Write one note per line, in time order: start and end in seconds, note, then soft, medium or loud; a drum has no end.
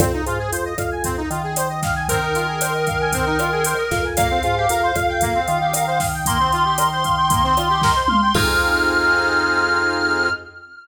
0.00 0.22 F2 loud
0.00 0.12 C4 loud
0.00 kick loud
0.00 cross-stick loud
0.00 closed hi-hat loud
0.13 0.25 D#4 medium
0.26 0.48 G#2 loud
0.26 0.38 F4 medium
0.26 closed hi-hat medium
0.39 0.51 G#4 medium
0.52 0.74 F2 loud
0.52 0.64 C5 medium
0.52 closed hi-hat loud
0.65 0.77 D#5 medium
0.78 1.23 F2 loud
0.78 0.90 F5 medium
0.78 kick medium
0.78 cross-stick medium
0.78 closed hi-hat medium
0.91 1.03 G#5 medium
1.04 1.16 C4 loud
1.04 kick medium
1.04 closed hi-hat loud
1.17 1.29 D#4 medium
1.30 3.74 D#3 loud
1.30 1.42 F4 medium
1.30 closed hi-hat medium
1.43 1.55 G#4 medium
1.56 1.68 C5 loud
1.56 cross-stick medium
1.56 closed hi-hat loud
1.70 1.81 D#5 medium
1.82 1.94 F5 medium
1.82 kick medium
1.82 snare medium
1.82 closed hi-hat medium
1.96 2.07 G#5 medium
2.09 2.21 C4 medium
2.09 4.05 A#4 medium
2.09 kick medium
2.09 closed hi-hat loud
2.22 2.34 D#4 medium
2.35 2.47 F4 medium
2.35 closed hi-hat medium
2.48 2.59 G#4 medium
2.61 2.73 C5 medium
2.61 cross-stick loud
2.61 closed hi-hat loud
2.74 2.86 D#5 medium
2.87 2.99 F5 medium
2.87 kick medium
2.87 closed hi-hat medium
3.00 3.12 G#5 medium
3.12 3.25 C4 medium
3.12 kick medium
3.12 closed hi-hat loud
3.26 3.38 D#4 medium
3.39 3.51 F4 medium
3.39 cross-stick loud
3.39 closed hi-hat medium
3.52 3.64 G#4 medium
3.64 3.77 C5 medium
3.64 closed hi-hat loud
3.78 3.90 D#5 medium
3.91 4.40 F2 loud
3.91 4.03 F5 medium
3.91 kick medium
3.91 snare medium
3.91 closed hi-hat medium
4.04 4.16 G#5 medium
4.17 4.29 A#3 loud
4.17 6.06 F5 medium
4.17 kick loud
4.17 cross-stick loud
4.17 closed hi-hat loud
4.30 4.42 C4 medium
4.43 4.66 G#2 loud
4.43 4.55 F4 medium
4.43 closed hi-hat medium
4.57 4.68 G4 medium
4.69 4.92 F2 loud
4.69 4.81 A#4 medium
4.69 closed hi-hat loud
4.83 4.94 C5 medium
4.95 5.40 F2 loud
4.95 5.07 F5 medium
4.95 kick medium
4.95 cross-stick medium
4.95 closed hi-hat medium
5.09 5.21 G5 medium
5.21 5.33 A#3 loud
5.21 kick medium
5.21 closed hi-hat loud
5.35 5.46 C4 medium
5.48 7.92 D#3 loud
5.48 5.59 F4 medium
5.48 closed hi-hat medium
5.61 5.73 G4 medium
5.73 5.86 A#4 medium
5.73 cross-stick medium
5.73 closed hi-hat loud
5.87 5.99 C5 medium
6.00 6.12 F5 medium
6.00 kick medium
6.00 snare medium
6.00 open hi-hat medium
6.13 6.25 G5 medium
6.26 6.38 A#3 loud
6.26 8.33 C6 medium
6.26 kick loud
6.26 closed hi-hat loud
6.39 6.51 C4 medium
6.52 6.64 F4 medium
6.52 closed hi-hat medium
6.65 6.77 G4 medium
6.78 6.90 A#4 medium
6.78 cross-stick loud
6.78 closed hi-hat loud
6.91 7.03 C5 medium
7.04 7.16 F5 medium
7.04 kick medium
7.04 closed hi-hat medium
7.17 7.29 G5 medium
7.30 7.42 A#3 medium
7.30 kick loud
7.30 closed hi-hat loud
7.43 7.55 C4 loud
7.57 7.68 F4 medium
7.57 cross-stick medium
7.57 closed hi-hat medium
7.69 7.81 G4 medium
7.82 7.94 A#4 loud
7.82 kick loud
7.82 snare medium
7.96 8.07 C5 medium
8.08 8.20 F5 medium
8.08 mid tom loud
8.22 8.33 G5 medium
8.34 10.29 F2 loud
8.34 10.29 C4 loud
8.34 10.29 D#4 loud
8.34 10.29 F4 loud
8.34 10.29 G#4 loud
8.34 10.29 F6 loud
8.34 kick loud
8.34 crash loud